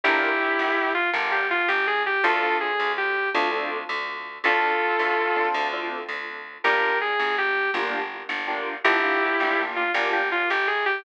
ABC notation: X:1
M:12/8
L:1/8
Q:3/8=109
K:Dm
V:1 name="Distortion Guitar"
[EG]5 F z G F G _A G | [FA]2 _A2 G2 z6 | [FA]6 z6 | [GB]2 _A2 G2 z6 |
[EG]5 F z G F G _A G |]
V:2 name="Acoustic Grand Piano"
[DFGB]6 [DFGB]6 | [CDFA] [CDFA]5 [CDFA] [CDFA]5 | [CDFA]5 [CDFA]2 [CDFA]5 | [B,DFG]6 [B,DFG]4 [B,DFG]2 |
[B,DFG] [B,DFG]2 [B,DFG] [B,DFG]2 [B,DFG]6 |]
V:3 name="Electric Bass (finger)" clef=bass
G,,,3 G,,,3 G,,,3 G,,,3 | D,,3 D,,3 D,,3 D,,3 | D,,3 D,,3 D,,3 D,,3 | G,,,3 G,,,3 G,,,3 G,,,3 |
G,,,3 G,,,3 G,,,3 G,,,3 |]